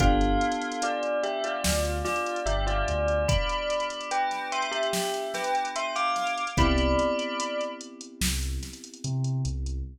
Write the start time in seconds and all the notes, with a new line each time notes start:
0.00 G1 B3 D4 F4 G4 A4 F5, kick, closed hi-hat
0.21 closed hi-hat
0.41 closed hi-hat
0.52 closed hi-hat
0.62 closed hi-hat
0.72 closed hi-hat
0.82 F4 D5, closed hi-hat
1.03 closed hi-hat
1.23 G4 E5, closed hi-hat
1.44 F4 D5, closed hi-hat
1.64 D2, snare
1.85 closed hi-hat
2.05 F4 D5, snare, closed hi-hat
2.16 closed hi-hat
2.26 closed hi-hat
2.36 closed hi-hat
2.46 G1 G4 E5, closed hi-hat
2.67 F4 D5, closed hi-hat
2.88 D2, closed hi-hat
3.08 closed hi-hat
3.28 D5 B5, kick, closed hi-hat
3.49 closed hi-hat
3.70 closed hi-hat
3.80 closed hi-hat
3.90 closed hi-hat
4.01 closed hi-hat
4.11 B4 G5, closed hi-hat
4.31 snare, closed hi-hat
4.52 E5 C6, closed hi-hat
4.62 closed hi-hat
4.72 G4 E5, closed hi-hat
4.83 closed hi-hat
4.93 snare
5.14 closed hi-hat
5.34 B4 G5, snare, closed hi-hat
5.44 closed hi-hat
5.55 closed hi-hat
5.65 closed hi-hat
5.76 E5 C6, closed hi-hat
5.96 F5 D6, closed hi-hat
6.16 snare, closed hi-hat
6.27 closed hi-hat
6.38 closed hi-hat
6.47 closed hi-hat
6.57 C2 B3 C4 E4 G4 D5 B5, kick, closed hi-hat
6.78 closed hi-hat
6.99 closed hi-hat
7.19 closed hi-hat
7.40 closed hi-hat
7.61 closed hi-hat
7.81 closed hi-hat
8.01 closed hi-hat
8.21 C2, snare
8.43 closed hi-hat
8.63 snare, closed hi-hat
8.73 closed hi-hat
8.84 closed hi-hat
8.94 closed hi-hat
9.04 C3, closed hi-hat
9.24 closed hi-hat
9.45 C2, closed hi-hat
9.66 closed hi-hat